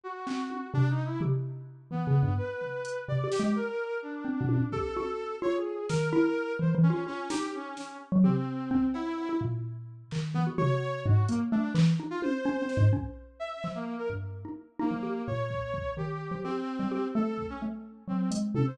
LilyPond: <<
  \new Staff \with { instrumentName = "Xylophone" } { \time 5/8 \tempo 4 = 128 r8 c'4 c4 | g'4. \tuplet 3/2 { e8 des8 g,8 } | r4. \tuplet 3/2 { c8 g'8 aes8 } | r4. \tuplet 3/2 { c'8 b,8 bes,8 } |
g'8 ges'4 f'4 | ees8 e'4 \tuplet 3/2 { e8 e8 f'8 } | f'8 ees'4. r16 ges16 | g'4 c'8 r8. e'16 |
bes,4. ees8 e16 ges'16 | ges'4 aes,8 bes8 a8 | e8 ees'8 r8 \tuplet 3/2 { des'8 c'8 aes,8 } | des'4. f4 |
g,8. ees'16 r8 ees'16 f16 g'8 | bes,4. ees8. f16 | g'8. g16 g'8 a4 | a4 ges8 aes8 c8 | }
  \new Staff \with { instrumentName = "Brass Section" } { \time 5/8 ges'4. \tuplet 3/2 { d'8 ees'8 e'8 } | r4. b4 | b'4. d''8 g'8 | bes'4 d'4. |
a'4. des''16 aes'8. | bes'4. c''16 r16 des'8 | des'8 g'8 des'8 des'8 r8 | c'4. e'4 |
r2 b16 r16 | des''4 ges'8 bes16 r16 d'8 | r8. f'16 c''4. | r4 e''8. bes8 bes'16 |
r4. bes4 | des''4. g'4 | c'4. a'8. des'16 | r4 c'8 r8 a'16 c''16 | }
  \new DrumStaff \with { instrumentName = "Drums" } \drummode { \time 5/8 r8 hc8 tommh8 r4 | tomfh4. r4 | r8 tomfh8 hh8 r8 sn8 | r4. r8 tommh8 |
bd8 tommh4 r4 | sn4. r4 | r8 sn4 sn4 | tomfh4 bd8 cb8 cb8 |
r4. hc4 | tomfh4. hh4 | hc4 tommh8 r8 sn8 | bd4. hc4 |
r4. r4 | r8 bd8 bd8 r4 | r4. r8 bd8 | r4. hh8 tommh8 | }
>>